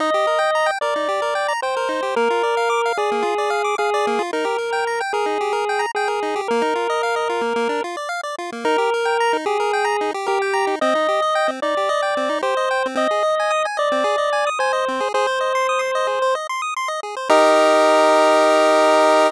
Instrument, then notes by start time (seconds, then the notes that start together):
lead 1 (square)
0.00 D#4 D#5
0.14 G4
0.27 A#4
0.39 G5
0.55 A#5
0.66 G5
0.81 A#4 D5
0.96 D#4
1.09 G4
1.22 A#4
1.35 G5
1.48 A#5
1.62 C5 G5
1.77 A#4
1.89 D#4
2.03 G4
2.16 A#3 A#4
2.30 F4
2.43 D5
2.57 F5
2.70 D6
2.86 F5
2.97 G#4 D5
3.12 A#3
3.23 F4
3.38 D5
3.50 F5
3.64 D6
3.78 G#4 F5
3.94 D5
4.07 A#3
4.19 F4
4.33 D#4 A#4
4.45 G4
4.58 A#4
4.73 G5
4.87 A#5
5.01 G5
5.13 G#4 A#4
5.26 D#4
5.41 G4
5.53 A#4
5.69 G5
5.79 A#5
5.95 G#4 G5
6.08 A#4
6.23 D#4
6.36 G4
6.48 A#3 A#4
6.62 D#4
6.75 F4
6.90 D#5
7.03 F5
7.16 D#5
7.30 F4
7.41 A#3
7.56 A#3
7.69 D4
7.84 F4
7.97 D5
8.09 F5
8.23 D5
8.39 F4
8.52 A#3
8.65 D#4 A#4
8.78 G4
8.94 A#4
9.05 G5
9.20 A#5
9.33 D#4
9.46 G4 G#4
9.60 A#4
9.73 G5
9.85 A#5
10.01 D#4
10.14 G4
10.27 G4 A#4
10.42 G5
10.53 A#5
10.67 D#4
10.81 C4 D#5
10.95 D#4
11.09 G4
11.22 D#5
11.35 G5
11.48 C4
11.62 D#4 D5
11.77 G4
11.89 D#5
12.02 G5
12.17 C4
12.29 D#4
12.42 G4 C5
12.57 D#5
12.71 G5
12.86 C4
12.95 C4 D#5
13.11 G#4
13.23 D#5
13.40 G#5
13.51 D#6
13.65 G#5
13.77 D5 D#5
13.92 C4
14.04 G#4
14.18 D#5
14.33 G#5
14.47 D#6
14.59 C5 G#5
14.73 D#5
14.88 C4
15.00 G#4
15.14 G#4 C5
15.27 C5
15.41 D#5
15.55 C6
15.69 D#6
15.79 C6
15.95 D#5
16.07 G#4
16.22 C5
16.35 D#5
16.49 C6
16.62 D#6
16.76 C6
16.88 D#5
17.03 G#4
17.17 C5
17.30 D#4 G4 A#4 D#5